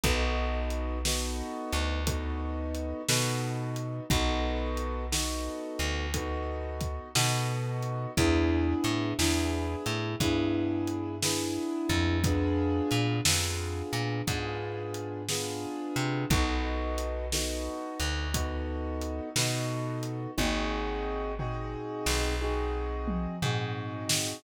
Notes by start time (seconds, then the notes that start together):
0.03 B1 B3 D#4 F#4 A4, kick, closed hi-hat
0.70 closed hi-hat
1.05 B3 D#4 F#4 A4, snare
1.72 D2, closed hi-hat
2.07 B3 D#4 F#4 A4, kick, closed hi-hat
2.75 closed hi-hat
3.08 B2 B3 D#4 F#4 A4, snare
3.76 closed hi-hat
4.10 B1 B3 D#4 F#4 A4, kick, closed hi-hat
4.77 closed hi-hat
5.12 B3 D#4 F#4 A4, snare
5.79 D2, closed hi-hat
6.14 B3 D#4 F#4 A4, kick, closed hi-hat
6.81 kick, closed hi-hat
7.15 B2 B3 D#4 F#4 A4, snare
7.82 closed hi-hat
8.17 E2 B3 D4 E4 G#4, kick, closed hi-hat
8.84 A2, closed hi-hat
9.18 E2 B3 D4 E4 G#4, snare
9.86 A2, closed hi-hat
10.20 G2 B3 D4 E4 G#4, kick, closed hi-hat
10.87 closed hi-hat
11.22 B3 D4 E4 G#4, snare
11.89 F2, kick, closed hi-hat
12.24 B3 D4 F4 G#4, kick, closed hi-hat
12.91 A#2, closed hi-hat
13.25 F2 B3 D4 F4 G#4, snare
13.93 A#2, closed hi-hat
14.27 G#2 B3 D4 F4 G#4, kick, closed hi-hat
14.94 closed hi-hat
15.29 B3 D4 F4 G#4, snare
15.96 C3, closed hi-hat
16.30 B1 B3 D#4 F#4 A4, kick, closed hi-hat
16.98 closed hi-hat
17.32 B3 D#4 F#4 A4, snare
18.00 D2, closed hi-hat
18.34 B3 D#4 F#4 A4, kick, closed hi-hat
19.01 closed hi-hat
19.36 B2 B3 D#4 F#4 A4, snare
20.03 closed hi-hat
20.37 G#1 C4 D#4 F#4 G#4, kick, high tom
21.39 C4 D#4 F#4 G#4, floor tom
22.06 B1, snare
22.41 C4 D#4 F#4 G#4
23.07 mid tom
23.42 G#2 C4 D#4 F#4 G#4, floor tom
24.09 snare